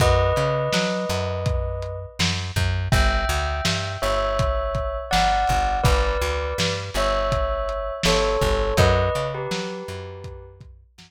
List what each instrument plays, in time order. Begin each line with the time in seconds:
0.00 electric bass (finger) F#2, tubular bells B4 D#5, kick, closed hi-hat
0.36 electric bass (finger) C#3, closed hi-hat
0.73 electric bass (finger) F#3, snare
1.09 electric bass (finger) F#2, closed hi-hat
1.46 kick, closed hi-hat
1.82 closed hi-hat
2.19 electric bass (finger) F#2, snare
2.56 electric bass (finger) F#2, kick, closed hi-hat
2.92 electric bass (finger) G1, tubular bells E5 G5, kick, closed hi-hat
3.29 electric bass (finger) D2, closed hi-hat
3.65 electric bass (finger) G2, snare
4.02 electric bass (finger) G1, tubular bells C#5 E5, closed hi-hat
4.39 kick, closed hi-hat
4.75 kick, closed hi-hat
5.11 electric bass (finger) G1, tubular bells D5 F#5, snare
5.47 electric bass (finger) G1, kick, closed hi-hat
5.84 electric bass (finger) G1, tubular bells B4 D5, kick, closed hi-hat
6.21 electric bass (finger) D2, closed hi-hat
6.58 electric bass (finger) G2, snare
6.94 electric bass (finger) G1, tubular bells C#5 E5, closed hi-hat
7.32 kick, closed hi-hat
7.69 closed hi-hat
8.03 electric bass (finger) G1, tubular bells A4 C#5, snare
8.41 electric bass (finger) G1, kick, closed hi-hat
8.77 electric bass (finger) F#2, tubular bells B4 D#5, kick, closed hi-hat
9.15 electric bass (finger) C#3, closed hi-hat
9.34 tubular bells G4 B4
9.51 electric bass (finger) F#3, snare
9.88 electric bass (finger) F#2, closed hi-hat
10.24 kick, closed hi-hat
10.61 kick, closed hi-hat
10.98 electric bass (finger) F#2, snare